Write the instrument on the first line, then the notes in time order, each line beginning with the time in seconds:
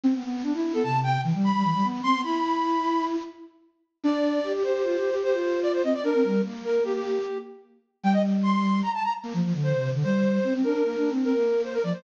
flute
0.04 C4
0.14 B3
0.24 B3
0.43 D4
0.54 E4
0.74 B3 A4
0.83 C3 A5
1.03 G5
1.24 E3
1.34 G3
1.44 B5
1.54 G3
1.64 E3
1.74 G3
1.84 B3
2.03 C4 C6
2.14 B3
2.24 E4 B5
4.04 D4 D5
4.44 G4
4.54 G4
4.63 G4 C5
4.74 G4
4.83 F4
4.97 G4
5.10 G4
5.23 G4 C5
5.33 F4
5.63 D5
5.73 C5
5.83 C4 D#5
5.94 D5
6.04 D4 A#4
6.14 C4
6.24 G3
6.44 A#3
6.65 A#4
6.83 A#3 G4
6.93 G4
8.03 G3 G5
8.13 D#5
8.43 C6
8.83 A#5
8.94 A5
9.04 A#5
9.24 A#3
9.34 F3
9.44 F3
9.54 D3
9.63 C5
9.74 C3
9.94 D3
10.04 G3 C5
10.44 C4
10.54 C4
10.63 D4 A#4
10.74 D4
10.84 A#3
10.97 D4
11.10 C4
11.24 C4 A#4
11.34 A#3
11.64 C5
11.73 A#4
11.83 F3 D5
11.93 C5